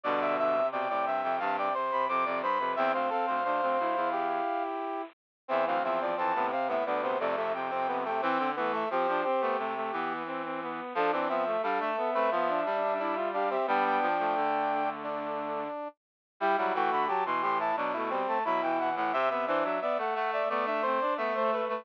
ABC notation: X:1
M:4/4
L:1/16
Q:1/4=88
K:C
V:1 name="Brass Section"
d2 e2 g3 g a g z b d'2 b2 | g f f10 z4 | [K:Am] e f e d a2 f e d c d e g3 g | g2 z e c4 z8 |
A c e2 f e9 f e | g g7 z8 | [K:Em] g f g b a c' c' a z3 a b g f f | c B c e d f f d z3 d e c B B |]
V:2 name="Brass Section"
d e e2 d d e2 f d c2 c d c B | e c A c c4 G6 z2 | [K:Am] C C C2 C B, C B, B, B, A, A, z C B, A, | C2 B, A, G2 G6 z4 |
F D C z A3 B F2 D2 D z D C | D8 D6 z2 | [K:Em] E E F2 G z G E D E C2 E3 z | e e e2 e z e e d e c2 e3 z |]
V:3 name="Brass Section"
D,2 D, C, C, C,3 C, C, C, C, C, C, z C, | C C C2 D C E E7 z2 | [K:Am] E,2 F, F, E, C,3 D, C, C, C, C, C, C, C, | C2 A,2 C D C B, A, A, B,2 C C B,2 |
D C B, A, D2 B, C B, D2 D E F G G | B,3 A,9 z4 | [K:Em] G, F, A,2 F, E,3 F, A, G, A, F, E, E, E, | C B, D2 B, A,3 B, D C D B, A, A, A, |]
V:4 name="Brass Section"
[G,,B,,]4 B,, A,, G,, F,, G,,2 z2 F,, F,, G,, F,, | E,, D,, z D,, D,, D,, D,, E,,3 z6 | [K:Am] E,, D,, E,,2 F,, A,, z A,, D,,2 F,,6 | E, D, E,2 F, F, z A, C,2 E,6 |
F, E, F,2 G, A, z A, F,2 G,6 | G,2 F, F, D,8 z4 | [K:Em] G, G, E, D, z B,, A,,2 B,,3 z B,,3 A,, | C, C, E, F, z A, A,2 A,3 z A,3 A, |]